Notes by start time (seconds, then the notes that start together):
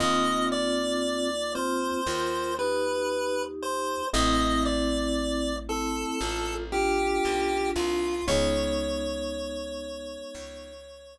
0.00 D#2 A#3 C4 D#4 F4 D#5
0.52 D5
1.55 C4 F4 C5
2.06 D#2 F4 A#4
2.59 D#4 G4 B4
3.63 C5
4.13 A1 A3 C4 E4 D#5
4.65 D5
5.69 C4 E4 A4
6.21 A1 F4 A4
6.72 D4 F4 G4
7.25 B1
7.76 C2 F4
8.28 C#2 G#3 B3 C#4 D#4 C#5
10.34 C#2